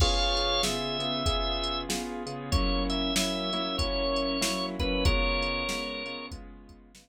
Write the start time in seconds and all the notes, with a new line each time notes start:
0.00 C#3 B3 F4 G#4 C#5 F5, kick, crash
0.37 closed hi-hat
0.63 C#3 B3 F4 G#4 E5, snare
0.99 C#3 B3 F4 G#4, closed hi-hat
1.26 C#3 B3 F4 G#4, kick, closed hi-hat
1.64 closed hi-hat
1.89 C#3 B3 F4 G#4, snare
2.26 C#3 B3 F4 G#4, closed hi-hat
2.52 F#3 A#3 C#4 E4 C#5, kick, closed hi-hat
2.90 E5, closed hi-hat
3.16 F#3 A#3 C#4 E4 E5, snare
3.53 F#3 A#3 C#4 E4, closed hi-hat
3.78 F#3 A#3 C#4 E4 C#5, kick, closed hi-hat
4.16 closed hi-hat
4.41 F#3 A#3 C#4 E4, snare
4.79 F#3 A#3 C#4 E4 B4, kick, closed hi-hat
5.05 C#3 G#3 B3 F4 A#4 C#5, kick, closed hi-hat
5.43 closed hi-hat
5.68 C#3 G#3 B3 F4, snare
6.06 C#3 G#3 B3 F4, closed hi-hat
6.31 C#3 G#3 B3 F4, kick, closed hi-hat
6.69 kick, closed hi-hat
6.95 C#3 G#3 B3 F4, snare